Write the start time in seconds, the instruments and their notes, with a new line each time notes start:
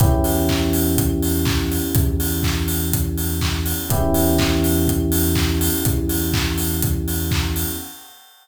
0.00 synth bass 1 E2, electric piano 1 B3 C#4 E4 G4, kick, closed hi-hat
0.24 open hi-hat
0.49 kick, clap
0.73 open hi-hat
0.98 kick, closed hi-hat
1.22 open hi-hat
1.45 kick, clap
1.72 open hi-hat
1.95 synth bass 1 E2, kick, closed hi-hat
2.20 open hi-hat
2.43 kick, clap
2.68 open hi-hat
2.93 kick, closed hi-hat
3.18 open hi-hat
3.41 kick, clap
3.66 open hi-hat
3.90 synth bass 1 E2, electric piano 1 B3 C#4 E4 G4, kick, closed hi-hat
4.14 open hi-hat
4.38 kick, clap
4.64 open hi-hat
4.88 kick, closed hi-hat
5.12 open hi-hat
5.35 kick, clap
5.61 open hi-hat
5.85 synth bass 1 E2, kick, closed hi-hat
6.09 open hi-hat
6.34 kick, clap
6.58 open hi-hat
6.82 kick, closed hi-hat
7.08 open hi-hat
7.31 kick, clap
7.56 open hi-hat